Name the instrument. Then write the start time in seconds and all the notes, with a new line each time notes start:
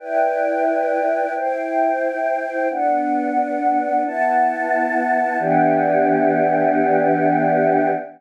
choir aahs
0.00 E4 B4 D5 G5
1.35 E4 C5 G5
2.70 B3 D4 F#5
4.04 B3 E4 F#5 A5
5.39 E3 B3 D4 G4